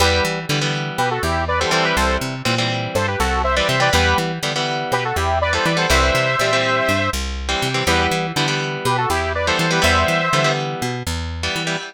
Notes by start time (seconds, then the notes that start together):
0.00 E2 E3 G3 B3 G4 B4
0.25 E3
0.49 D3 E3 G3 B3
0.61 E3 G3 B3
0.98 B2 G4 B4
1.11 F#4 A4
1.23 E2 E4 G4
1.48 B4 D5
1.60 E3 G3 B3 A4 C5
1.71 E3 G3 C4 A4 C5
1.84 G4 B4
1.96 C2 A4 C5
2.21 C3
2.45 A#2 E3 G3 C4
2.58 E3 G3 C4
2.95 G2 A4 C5
3.08 G4 B4
3.19 C2 F#4 A4
3.44 C5 E5
3.56 E3 G3 C4 B4 D5
3.68 C3 C5 E5
3.80 E3 G3 C4 B4 D5
3.93 E2 E3 G3 B3 G4 B4
4.18 E3
4.43 D3 E3 G3 B3
4.56 E3 G3 B3
4.92 B2 G4 B4
5.05 F#4 A4
5.16 E2 E4 G4
5.41 B4 D5
5.53 E3 G3 B3 A4 C5
5.65 E3 B4 D5
5.77 E3 G3 B3 A4 C5
5.90 C2 E3 G3 C4 C5 E5
6.15 C3
6.39 A#2 E3 G3 C4
6.53 E3 G3 C4
6.89 G2
7.13 C2
7.49 E3 G3 C4
7.62 C3
7.74 E3 G3 C4
7.87 E2 E3 G3 B3 G4 B4
8.11 E3
8.36 D3 E3 G3 B3
8.48 E3 G3 B3
8.85 B2 G4 B4
8.98 F#4 A4
9.10 E2 E4 G4
9.35 B4 D5
9.47 E3 G3 B3 A4 C5
9.59 E3 A4 C5
9.71 E3 G3 B3 G4 B4
9.82 E2 E3 G3 B3 C5 E5
10.08 E3
10.33 D3 E3 G3 B3
10.44 E3 G3 B3
10.82 B2
11.07 E2
11.43 E3 G3 B3
11.56 E3
11.67 E3 G3 B3